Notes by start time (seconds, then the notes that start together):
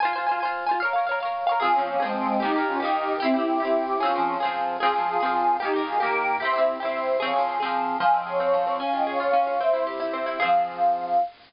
0.00 C5 G#5
0.05 F4
0.13 C5 G#5
0.18 F4
0.27 C5 G#5
0.31 F4
0.40 C5 G#5
0.45 F4
0.66 C5 G#5
0.71 F4
0.80 C#5 F5
0.85 A#4
0.93 C#5 F5
0.98 A#4
1.07 C#5 F5
1.11 A#4
1.20 C#5 F5
1.25 A#4
1.47 C#5 F5
1.52 A#4
1.60 C4 F4 G#4
1.65 F3
1.72 C#4 F4 G#4
1.76 F3 C4
1.86 A#3 C#4
2.00 G#3 C4 G#4
2.05 F3
2.14 G#3 C4
2.40 A#3 D#4 G4
2.45 D#3
2.53 A#3 G4
2.58 D#3
2.66 C#4 F4
2.80 A#3 D#4 G4
2.85 D#3
3.20 C4 E4 G4
3.25 C4
3.34 E4 G4
3.39 C4
3.60 E4 G4
3.65 C4
3.98 C#4 F4 G#4
4.03 F3 C4
4.13 C4 G#4
4.18 F3
4.40 C4 G#4
4.45 F3
4.80 C4 F4 G#4
4.85 F3
4.93 C4 G#4
4.98 F3
5.07 F4 G#4
5.20 C4 F4 G#4
5.25 F3
5.59 A#3 D#4 G4
5.65 D#3
5.73 A#3 G4
5.78 D#3
5.84 F4 G#4
5.99 A#3 G4 A#4
6.05 D#3
6.40 E4 G4 C5 E5
6.45 C4
6.53 E4 G4
6.58 C4
6.80 E4 G4 C5 E5
6.85 C4
7.19 C4 G#4 C#5 F5
7.25 F3
7.33 C4 G#4
7.38 F3
7.60 C4 G#4
7.65 F3
8.00 F3 F5 G#5
8.14 C4 D#5 G5
8.26 G#4 C#5 F5
8.38 C4 C#5 F5
8.53 F3
8.67 C4
8.78 C#4 F5 G#5
8.93 F4 D#5 G5
9.07 G#4 C#5 F5
9.19 F4 C#5 F5
9.33 C#4
9.47 F4
9.60 C4 C5 E5
9.73 E4
9.87 G4
10.00 E4
10.13 C4
10.26 E4
10.38 G#4 F5
10.42 F3 C4